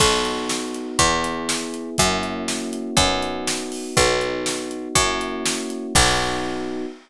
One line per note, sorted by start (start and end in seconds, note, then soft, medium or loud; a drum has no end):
0.00 0.91 B1 medium
0.00 0.97 B3 medium
0.00 0.97 D#4 medium
0.00 0.97 F#4 medium
0.00 kick medium
0.00 crash loud
0.25 closed hi-hat medium
0.49 snare medium
0.74 closed hi-hat medium
0.99 1.90 E2 loud
0.99 1.96 B3 medium
0.99 1.96 E4 medium
0.99 1.96 G#4 medium
0.99 kick medium
0.99 closed hi-hat medium
1.24 closed hi-hat medium
1.49 snare loud
1.74 closed hi-hat medium
1.98 2.90 F#2 loud
1.98 2.96 A#3 medium
1.98 2.96 C#4 medium
1.98 2.96 E4 medium
1.98 2.96 F#4 medium
1.98 kick medium
1.98 closed hi-hat medium
2.23 closed hi-hat medium
2.48 snare medium
2.73 closed hi-hat medium
2.97 3.88 F#2 loud
2.97 3.95 B3 medium
2.97 3.95 D#4 medium
2.97 3.95 F#4 medium
2.97 kick loud
2.97 closed hi-hat loud
3.22 closed hi-hat medium
3.47 snare loud
3.72 open hi-hat medium
3.96 4.88 B1 medium
3.96 4.94 B3 medium
3.96 4.94 D#4 medium
3.96 4.94 F#4 medium
3.96 kick medium
3.96 closed hi-hat medium
4.21 closed hi-hat medium
4.46 snare medium
4.71 closed hi-hat medium
4.95 5.87 F#2 loud
4.95 5.93 A#3 medium
4.95 5.93 C#4 medium
4.95 5.93 E4 medium
4.95 5.93 F#4 medium
4.95 kick medium
4.95 closed hi-hat medium
5.21 closed hi-hat medium
5.46 snare loud
5.70 closed hi-hat medium
5.95 6.86 B1 loud
5.95 6.85 B3 medium
5.95 6.85 D#4 loud
5.95 6.85 F#4 loud
5.95 kick loud
5.95 crash loud